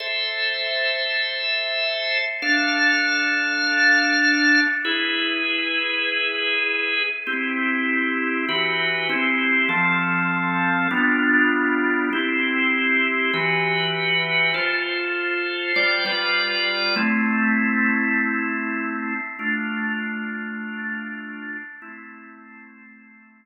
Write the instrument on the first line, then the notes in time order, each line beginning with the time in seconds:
drawbar organ
0.00 A4 C5 E5
2.42 D4 A4 F5
4.85 E4 G#4 B4
7.27 C4 E4 G4
8.49 E3 F#4 G4 B4
9.09 C4 E4 G4
9.69 F3 C4 A4
10.91 G3 B3 D4 F4
12.13 C4 E4 G4
13.33 E3 F#4 G4 B4
14.54 F4 A4 C5
15.76 G3 F4 C5 D5
16.05 G3 F4 B4 D5
16.96 A3 C4 E4
19.39 A3 D4 F4
21.82 A3 C4 E4